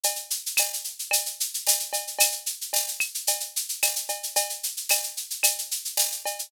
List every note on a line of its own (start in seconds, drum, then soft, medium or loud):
0.03 cowbell medium
0.03 shaker loud
0.16 shaker medium
0.31 shaker medium
0.46 shaker medium
0.57 tambourine medium
0.57 cowbell medium
0.57 claves loud
0.57 shaker loud
0.73 shaker medium
0.84 shaker medium
0.99 shaker medium
1.11 cowbell medium
1.11 claves medium
1.11 shaker loud
1.26 shaker medium
1.40 shaker medium
1.54 shaker medium
1.67 tambourine medium
1.67 cowbell medium
1.67 shaker loud
1.80 shaker medium
1.93 cowbell medium
1.93 shaker medium
2.07 shaker medium
2.19 cowbell loud
2.19 claves loud
2.19 shaker loud
2.32 shaker medium
2.46 shaker medium
2.61 shaker medium
2.73 tambourine medium
2.73 cowbell medium
2.73 shaker loud
2.88 shaker medium
3.00 claves loud
3.00 shaker medium
3.15 shaker medium
3.27 cowbell medium
3.27 shaker loud
3.40 shaker medium
3.56 shaker medium
3.69 shaker medium
3.83 tambourine medium
3.83 cowbell medium
3.83 claves medium
3.83 shaker loud
3.96 shaker medium
4.09 cowbell medium
4.09 shaker medium
4.23 shaker medium
4.36 cowbell loud
4.36 shaker loud
4.50 shaker medium
4.63 shaker medium
4.77 shaker medium
4.89 tambourine medium
4.89 cowbell medium
4.89 claves loud
4.89 shaker loud
5.03 shaker medium
5.17 shaker medium
5.30 shaker medium
5.43 cowbell medium
5.43 claves loud
5.43 shaker loud
5.58 shaker medium
5.71 shaker medium
5.85 shaker medium
5.97 tambourine medium
5.97 cowbell medium
5.97 shaker loud
6.12 shaker medium
6.26 cowbell medium
6.26 shaker medium
6.39 shaker medium